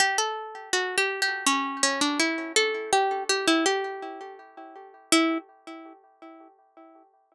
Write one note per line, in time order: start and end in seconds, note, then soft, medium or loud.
0.00 0.17 G4 medium
0.18 0.70 A4 medium
0.73 0.96 F#4 medium
0.98 1.21 G4 medium
1.22 1.45 G4 medium
1.46 1.82 C#4 medium
1.83 2.00 C#4 medium
2.01 2.19 D4 medium
2.20 2.52 E4 medium
2.56 2.91 A4 medium
2.93 3.24 G4 medium
3.29 3.47 G4 medium
3.48 3.65 E4 medium
3.66 4.36 G4 medium
5.12 5.38 E4 loud